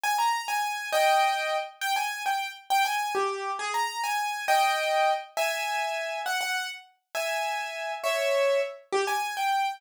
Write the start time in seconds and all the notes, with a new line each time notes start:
0.03 G#5
0.18 A#5
0.48 G#5
0.92 D#5 G5
1.81 G5
1.96 G#5
2.26 G5
2.70 G5
2.85 G#5
3.15 G4
3.59 G#4
3.74 A#5
4.04 G#5
4.48 D#5 G5
5.37 E5 G#5
6.26 F#5
6.41 F#5
7.15 E5 G#5
8.04 C#5 E5
8.92 G4
9.07 G#5
9.37 G5